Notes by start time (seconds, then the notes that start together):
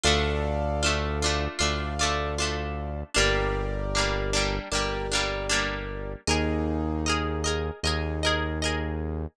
0.04 D2 A3 D4 F4 A4 D5 F5
0.83 A3 D4 F4
1.22 A3 D4 F4
1.59 D2 A3 D4 F4 A4 D5 F5
1.99 A3 D4 F4
2.38 A3 D4 F4
3.14 G1 G3 A#3 D4 G4 A#4 D5
3.95 G3 A#3 D4
4.33 G3 A#3 D4
4.72 G1 G3 A#3 D4 G4 A#4 D5
5.12 G3 A#3 D4
5.50 G3 A#3 D4
6.27 D#2 A#3 D#4 G#4 A#4 D#5
7.06 G#4 A#4 D#5
7.44 G#4 A#4 D#5
7.83 D#2 A#3 D#4 G#4 A#4 D#5
8.23 G#4 A#4 D#5
8.62 G#4 A#4 D#5